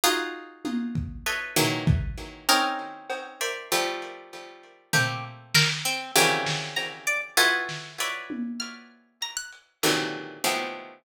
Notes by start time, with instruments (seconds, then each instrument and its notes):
0.04 harpsichord D#4 F4 F#4 G#4
0.65 high tom
0.95 kick
1.26 harpsichord A4 B4 C#5 D#5 E5
1.56 harpsichord D#3 E3 F#3 G#3 A#3, floor tom
1.87 kick
2.49 harpsichord C4 C#4 D#4, pizzicato strings A#4
3.10 cowbell
3.41 harpsichord A#4 C5 D5 E5
3.72 harpsichord F3 G3 A3
4.93 harpsichord A3 A#3 C4, pizzicato strings G4, floor tom
5.54 pizzicato strings A#4, snare
5.85 pizzicato strings C4
6.15 harpsichord C3 C#3 D#3 E3 F#3 G3
6.46 snare
6.76 pizzicato strings A#5, cowbell
7.07 pizzicato strings D5
7.37 harpsichord E4 F4 F#4 G#4 A4 B4
7.69 snare
8.00 harpsichord B4 C#5 D5 E5
8.30 high tom
8.60 pizzicato strings F6
9.22 pizzicato strings A#5, closed hi-hat
9.37 pizzicato strings F#6
9.52 closed hi-hat
9.83 harpsichord A#2 C3 D3 D#3 E3 F#3, clap
10.44 harpsichord F3 G3 G#3 A3 B3, cowbell